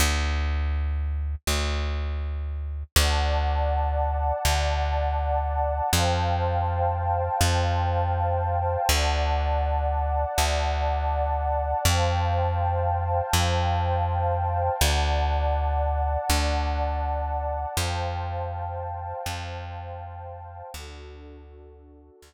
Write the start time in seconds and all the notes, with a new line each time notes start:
0.00 D2
1.47 D2
2.96 D2 D5 F#5 A5
4.45 D2
5.93 F2 C5 F5 G5 A5
7.41 F2
8.89 D2 D5 F#5 A5
10.38 D2
11.85 F2 C5 F5 G5 A5
13.33 F2
14.80 D2 D5 F#5 A5
16.30 D2
17.77 F2 C5 F5 G5 A5
19.26 F2
20.73 D2 D4 F#4 A4
22.22 D2